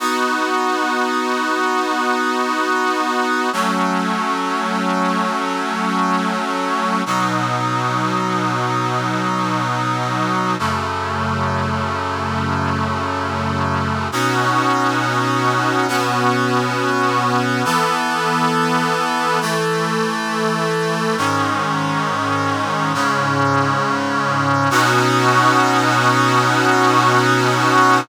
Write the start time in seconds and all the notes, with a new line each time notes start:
0.00 B3 D#4 F#4
3.53 F#3 A3 C#4
7.06 B2 F#3 D#4
10.59 F#2 C#3 A3
14.12 B2 C#4 D#4 F#4
15.88 B2 B3 C#4 F#4
17.65 E3 B3 A4
19.41 E3 A3 A4
21.18 G#2 D#3 C#4
22.94 G#2 C#3 C#4
24.71 B2 C#4 D#4 F#4